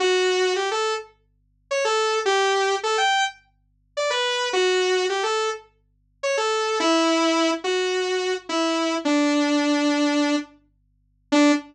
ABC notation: X:1
M:4/4
L:1/16
Q:1/4=106
K:D
V:1 name="Lead 2 (sawtooth)"
F4 G A2 z5 c A3 | G4 A g2 z5 d B3 | F4 G A2 z5 c A3 | E6 F6 E4 |
D10 z6 | D4 z12 |]